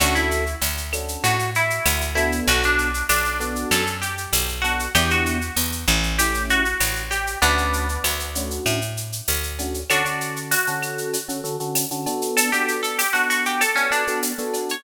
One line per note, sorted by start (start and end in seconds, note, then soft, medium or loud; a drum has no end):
0.00 0.55 D2 loud
0.00 0.44 C#4 medium
0.00 0.44 D4 loud
0.00 0.14 F#4 medium
0.00 0.44 F#4 medium
0.00 0.44 A4 loud
0.00 cowbell medium
0.00 claves medium
0.00 shaker loud
0.15 0.53 E4 medium
0.15 shaker medium
0.31 shaker medium
0.46 shaker medium
0.61 1.17 D2 medium
0.61 tambourine medium
0.61 cowbell medium
0.61 shaker medium
0.77 shaker medium
0.93 1.36 C#4 medium
0.93 1.36 D4 medium
0.93 1.36 F#4 medium
0.93 1.36 A4 medium
0.93 claves loud
0.93 shaker medium
1.08 shaker medium
1.24 1.80 A2 medium
1.24 1.51 F#4 medium
1.24 cowbell medium
1.24 shaker medium
1.39 shaker medium
1.55 2.12 E4 medium
1.55 shaker medium
1.70 shaker medium
1.86 2.41 D2 medium
1.86 tambourine medium
1.86 cowbell medium
1.86 claves loud
1.86 shaker loud
2.01 shaker medium
2.15 2.89 B3 loud
2.15 2.89 D4 loud
2.15 2.41 E4 medium
2.15 2.89 F#4 medium
2.15 2.89 A4 medium
2.15 cowbell medium
2.15 shaker medium
2.32 shaker medium
2.47 3.03 B1 loud
2.47 2.63 F#4 medium
2.47 cowbell medium
2.47 shaker loud
2.63 3.07 D4 medium
2.63 shaker medium
2.78 shaker medium
2.94 shaker medium
3.09 3.65 B1 medium
3.09 3.69 D4 medium
3.09 tambourine medium
3.09 cowbell medium
3.09 claves medium
3.09 shaker loud
3.25 shaker medium
3.40 3.84 B3 medium
3.40 3.84 D4 medium
3.40 3.84 F#4 medium
3.40 3.84 A4 medium
3.40 shaker medium
3.56 shaker medium
3.71 4.27 F#2 loud
3.71 3.98 A4 medium
3.71 cowbell medium
3.71 claves medium
3.71 shaker loud
3.87 shaker medium
4.02 4.53 G4 medium
4.02 shaker medium
4.18 shaker medium
4.33 4.88 B1 medium
4.33 tambourine medium
4.33 cowbell medium
4.33 shaker loud
4.48 shaker medium
4.62 4.86 B3 medium
4.62 4.86 D4 medium
4.62 4.90 F#4 medium
4.62 4.86 F#4 medium
4.62 4.86 A4 medium
4.62 cowbell medium
4.62 shaker medium
4.79 shaker medium
4.95 5.50 E2 loud
4.95 5.39 B3 medium
4.95 5.39 D4 medium
4.95 5.39 E4 loud
4.95 5.09 G4 medium
4.95 5.39 G4 loud
4.95 cowbell loud
4.95 claves loud
4.95 shaker loud
5.10 5.55 F#4 medium
5.10 shaker medium
5.26 shaker medium
5.41 shaker medium
5.56 5.86 E2 medium
5.56 tambourine medium
5.56 cowbell medium
5.56 shaker medium
5.72 shaker medium
5.88 6.74 A1 loud
5.88 claves medium
5.88 shaker medium
6.03 shaker medium
6.18 6.63 A3 medium
6.18 6.63 C#4 medium
6.18 6.63 E4 medium
6.18 6.43 G4 medium
6.18 6.63 G4 medium
6.18 cowbell medium
6.18 shaker loud
6.34 shaker medium
6.49 7.03 F#4 medium
6.49 shaker medium
6.65 shaker medium
6.80 7.36 A1 medium
6.80 tambourine medium
6.80 cowbell medium
6.80 claves medium
6.80 shaker loud
6.96 shaker medium
7.11 7.38 G4 medium
7.11 cowbell medium
7.11 shaker medium
7.27 shaker medium
7.42 7.98 D2 loud
7.42 7.86 A3 loud
7.42 8.58 B3 medium
7.42 7.86 C#4 loud
7.42 8.58 D4 medium
7.42 7.86 D4 loud
7.42 7.86 F#4 loud
7.42 cowbell medium
7.42 shaker medium
7.58 shaker medium
7.73 shaker medium
7.89 shaker medium
8.04 8.60 D2 medium
8.04 tambourine medium
8.04 cowbell medium
8.04 claves medium
8.04 shaker medium
8.20 shaker medium
8.35 8.79 A3 medium
8.35 8.79 C#4 medium
8.35 8.79 D4 medium
8.35 8.79 F#4 medium
8.35 shaker medium
8.51 shaker medium
8.66 9.21 A2 medium
8.66 cowbell medium
8.66 claves medium
8.66 shaker medium
8.81 shaker medium
8.97 shaker medium
9.12 shaker medium
9.28 9.84 D2 medium
9.28 tambourine medium
9.28 cowbell medium
9.28 shaker medium
9.43 shaker medium
9.59 9.81 A3 medium
9.59 9.81 C#4 medium
9.59 9.81 D4 medium
9.59 9.81 F#4 medium
9.59 cowbell medium
9.59 shaker medium
9.74 shaker medium
9.90 10.02 D3 medium
9.90 10.02 C#4 loud
9.90 10.40 D4 medium
9.90 10.02 F#4 loud
9.90 10.40 F#4 medium
9.90 10.02 A4 loud
9.90 cowbell medium
9.90 claves loud
9.90 shaker medium
10.05 10.54 D3 medium
10.05 10.54 C#4 medium
10.05 10.54 F#4 medium
10.05 10.54 A4 medium
10.05 shaker medium
10.21 shaker medium
10.36 shaker medium
10.51 11.71 F#4 medium
10.51 tambourine medium
10.51 cowbell medium
10.51 shaker loud
10.67 11.17 D3 medium
10.67 11.17 C#4 medium
10.67 11.17 F#4 medium
10.67 11.17 A4 medium
10.67 shaker medium
10.82 claves medium
10.82 shaker medium
10.98 shaker medium
11.13 cowbell medium
11.13 shaker loud
11.28 11.41 D3 medium
11.28 11.41 C#4 medium
11.28 11.41 F#4 medium
11.28 11.41 A4 medium
11.28 shaker medium
11.44 11.56 D3 medium
11.44 11.56 C#4 medium
11.44 11.56 F#4 medium
11.44 11.56 A4 medium
11.44 shaker medium
11.60 11.85 D3 medium
11.60 11.85 C#4 medium
11.60 11.85 F#4 medium
11.60 11.85 A4 medium
11.60 shaker medium
11.75 tambourine medium
11.75 cowbell medium
11.75 claves medium
11.75 shaker loud
11.91 12.06 D3 medium
11.91 12.06 C#4 medium
11.91 12.06 F#4 medium
11.91 12.06 A4 medium
11.91 shaker medium
12.06 12.50 B3 loud
12.06 12.50 D4 loud
12.06 12.50 F#4 medium
12.06 12.50 A4 loud
12.06 cowbell medium
12.06 shaker medium
12.22 shaker medium
12.37 12.51 A4 medium
12.37 cowbell medium
12.37 shaker loud
12.52 13.03 B3 medium
12.52 13.03 D4 medium
12.52 13.03 F#4 medium
12.52 12.81 G4 medium
12.52 13.03 A4 medium
12.52 shaker medium
12.68 shaker medium
12.83 12.97 A4 medium
12.83 shaker medium
12.99 13.13 G4 medium
12.99 tambourine medium
12.99 cowbell medium
12.99 claves medium
12.99 shaker loud
13.13 13.63 B3 medium
13.13 13.63 D4 medium
13.13 13.28 F#4 medium
13.13 13.63 F#4 medium
13.13 13.63 A4 medium
13.13 shaker medium
13.30 13.45 F#4 medium
13.30 shaker medium
13.45 13.61 G4 medium
13.45 shaker medium
13.61 13.76 A4 medium
13.61 cowbell medium
13.61 claves medium
13.61 shaker loud
13.75 13.88 B3 medium
13.75 13.90 C#4 medium
13.75 13.88 D4 medium
13.75 13.88 F#4 medium
13.75 13.88 A4 medium
13.75 shaker medium
13.91 14.03 B3 medium
13.91 14.03 D4 medium
13.91 14.20 D4 medium
13.91 14.03 F#4 medium
13.91 14.03 A4 medium
13.91 shaker medium
14.07 14.32 B3 medium
14.07 14.32 D4 medium
14.07 14.32 F#4 medium
14.07 14.32 A4 medium
14.07 shaker medium
14.23 tambourine medium
14.23 cowbell medium
14.23 shaker medium
14.38 14.75 B3 medium
14.38 14.75 D4 medium
14.38 14.75 F#4 medium
14.38 14.75 A4 loud
14.38 shaker medium
14.54 cowbell medium
14.54 shaker medium
14.69 14.84 C#5 medium
14.69 shaker medium